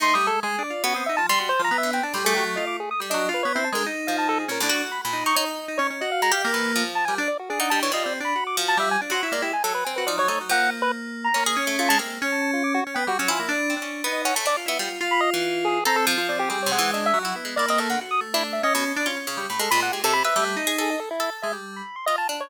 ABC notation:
X:1
M:7/8
L:1/16
Q:1/4=140
K:none
V:1 name="Lead 1 (square)"
(3c'2 _e'2 A2 _A2 d2 _G e' =e =a c' c' | (3c2 _b2 e2 g a c' _A G z _e d' A _e' | z _e2 B _d =E a _B z2 f a A _A | _B z3 =b b2 _d' _d z3 d z |
_e f _b f z =b2 z2 a _a z d _G | _A _g =a _d _e =d z b2 d' z a =e _a | z c' _d' =d G _a =A B _a B d _d d z | _g2 z B z3 _b2 z _e' z F a |
z3 a a F d' _G z =g _G z _a z | z6 _e _g a d z =e z2 | z b _e z3 _A2 _b =A z2 d G | _A _d _g2 (3_e2 =e2 _G2 z2 =d _e =A g |
z _e' z =E z e _e z7 | b A b _g =G A b e2 z3 _A _e | A E2 z e z2 b2 c' _e a z _d |]
V:2 name="Electric Piano 2"
(3_E2 G,2 _A,2 (3A,2 D2 F2 _D C E F, z _G | z F, B,3 D G,2 _G,2 F2 z2 | (3G,2 _G,2 F2 (3B,2 C2 _A,2 _E6 | _D =D2 z3 _E2 z3 E _D D |
_G3 z _B,4 z2 =G, D z2 | D4 (3F2 C2 D2 _G4 =G,2 | D _G E _B, E z4 G F, _G, A, G, | _B,8 B,2 _D4 |
_B,2 _D6 D =B, G, D F, _B, | (3D4 D4 _E4 z2 F =E F2 | F8 C3 F C2 | G,2 _A,4 _G,2 B,2 _B,4 |
_G2 A,4 _D3 =D _D D D =G, | z8 G,2 _E4 | z4 _A, G,3 z6 |]
V:3 name="Orchestral Harp"
A,4 z4 B,2 z2 G,2 | z3 D, C z A,, A,7 | G, D2 z4 D, z2 F,4 | _B,, A,, _G3 B,,2 _E E4 z2 |
z2 _A, G2 E,2 F,3 _B2 z2 | z _E G, =E, G,3 z3 F,4 | z _G,2 _A,3 G,2 C2 _E2 E2 | F,2 z6 _D _A z =A, A, _A, |
C2 z9 _G, E2 | z2 C _D2 B,2 D A, =D z B, G, z | z3 E,5 A2 F,4 | (3C2 C,2 E,2 D2 z E2 _A, E C =A, D, |
z3 D3 z B,, z2 F z _D,2 | A,, _A, _B,,2 A, C,2 =B =A,3 _A =A2 | z2 A3 z5 F2 D2 |]